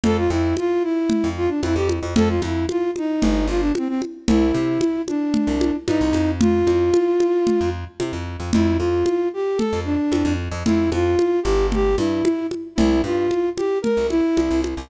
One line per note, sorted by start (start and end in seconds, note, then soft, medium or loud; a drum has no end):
0.04 0.28 F2 medium
0.04 0.17 A4 medium
0.04 low conga medium
0.17 0.30 F4 medium
0.30 0.54 F2 medium
0.30 0.56 E4 medium
0.57 0.83 F4 medium
0.57 high conga medium
0.83 1.29 E4 medium
1.10 low conga medium
1.24 1.48 F2 medium
1.37 1.50 F4 medium
1.49 1.61 D4 medium
1.63 1.75 F2 medium
1.63 1.75 E4 medium
1.63 high conga medium
1.75 2.00 F2 medium
1.75 1.88 G4 medium
1.89 high conga medium
2.03 2.15 F2 medium
2.16 2.40 F2 medium
2.16 2.29 A4 medium
2.16 low conga medium
2.29 2.41 F4 medium
2.42 2.66 F2 medium
2.42 2.66 E4 medium
2.42 high conga medium
2.69 2.91 F4 medium
2.69 high conga medium
2.96 3.47 D#4 medium
2.96 high conga medium
3.22 3.47 G1 medium
3.22 low conga medium
3.48 3.71 G1 medium
3.48 3.61 F4 medium
3.60 3.73 D4 medium
3.75 3.88 C4 medium
3.75 high conga medium
3.88 4.01 C4 medium
4.02 high conga medium
4.28 4.52 C2 medium
4.28 5.02 E4 medium
4.28 low conga medium
4.54 4.78 C3 medium
4.81 high conga medium
5.08 5.76 D4 medium
5.08 high conga medium
5.34 low conga medium
5.47 5.71 C2 medium
5.61 high conga medium
5.87 6.00 G2 medium
5.87 6.31 D#4 medium
5.87 high conga medium
6.01 6.13 C2 medium
6.13 6.63 F2 medium
6.13 high conga medium
6.41 7.70 F4 medium
6.41 low conga medium
6.67 6.91 F2 medium
6.67 high conga medium
6.94 high conga medium
7.20 high conga medium
7.47 low conga medium
7.61 7.85 F2 medium
8.00 8.12 C3 medium
8.00 high conga medium
8.13 8.37 F2 medium
8.40 8.52 F2 medium
8.53 8.78 F2 medium
8.53 8.77 E4 medium
8.53 low conga medium
8.78 9.04 F2 medium
8.78 9.29 F4 medium
9.06 high conga medium
9.34 9.59 G4 medium
9.57 9.80 A4 medium
9.57 low conga medium
9.73 9.97 F2 medium
9.85 10.34 D4 medium
10.12 10.24 F2 medium
10.12 high conga medium
10.25 10.49 F2 medium
10.52 10.63 F2 medium
10.66 10.90 F2 medium
10.66 10.90 E4 medium
10.66 low conga medium
10.92 11.16 F2 medium
10.92 11.40 F4 medium
10.92 high conga medium
11.19 high conga medium
11.43 11.95 G1 medium
11.43 11.67 G4 medium
11.43 high conga medium
11.72 11.96 G4 medium
11.72 low conga medium
11.98 12.22 G2 medium
11.98 12.47 E4 medium
11.98 high conga medium
12.25 high conga medium
12.51 high conga medium
12.76 13.02 C2 medium
12.76 13.01 E4 medium
12.76 low conga medium
13.04 13.28 G2 medium
13.04 13.49 F4 medium
13.31 high conga medium
13.57 13.79 G4 medium
13.57 high conga medium
13.82 14.07 A#4 medium
13.82 low conga medium
13.97 14.21 C2 medium
14.10 14.61 E4 medium
14.10 high conga medium
14.37 14.49 C2 medium
14.37 high conga medium
14.51 14.75 C2 medium
14.64 high conga medium
14.77 14.89 C2 medium